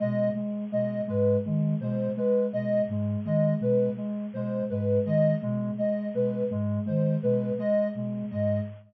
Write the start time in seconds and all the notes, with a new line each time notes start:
0.00 B2 G#3 D#5
0.35 G#3
0.72 B2 G#3 D#5
1.07 G#2 G#3 B4
1.45 D#3 G#3
1.80 B2 G#3 C5
2.17 G#3 B4
2.53 B2 G#3 D#5
2.88 G#2 G#3
3.25 D#3 G#3 D#5
3.60 B2 G#3 B4
3.97 G#3
4.33 B2 G#3 C5
4.70 G#2 G#3 B4
5.05 D#3 G#3 D#5
5.42 B2 G#3
5.78 G#3 D#5
6.14 B2 G#3 B4
6.50 G#2 G#3
6.86 D#3 G#3 C5
7.23 B2 G#3 B4
7.58 G#3 D#5
7.95 B2 G#3
8.31 G#2 G#3 D#5